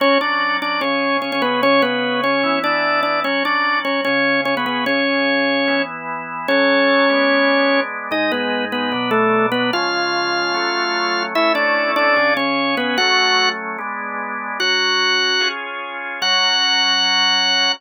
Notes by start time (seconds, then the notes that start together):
0.00 F#3 C#4 F#4 C#5
0.21 D4 D5
0.62 D4 D5
0.81 C#3 C#4 G#4 C#5
1.22 C#4 C#5
1.32 C#4 C#5
1.42 B3 B4
1.62 C#3 C#4 G#4 C#5
1.82 B3 B4
2.24 C#4 C#5
2.43 E3 B3 E4
2.64 D4 D5
3.03 D4 D5
3.24 F#3 C#4 F#4 C#5
3.45 D4 D5
3.85 C#4 C#5
4.05 C#3 C#4 G#4 C#5
4.45 C#4 C#5
4.57 B3 B4
4.66 B3 B4
4.86 C#3 C#4 G#4 C#5
5.68 E3 B3 E4
6.48 F#3 C#4 A4 C#5
7.10 G#3 B3 D4
8.11 G#2 G#3 D#4 D#5
8.32 B3 B4
8.72 B3 B4
8.92 B2 F#3 D4
9.11 A3 A4
9.52 B3 B4
9.73 C#3 F3 G#3 F4 F5
10.54 F#3 A3 C#4
11.35 A3 C#4 E4 E5
11.55 D4 D5
11.96 D4 D5
12.16 C#3 C#4 G#4
12.37 C#4 C#5
12.77 B3 B4
12.97 F#3 A3 C#4 F#4 F#5
13.78 G#3 B3 D4
14.60 F#3 C#4 F#4 F#5
15.41 C#4 F4 G#4
16.22 F#3 C#4 F#4 F#5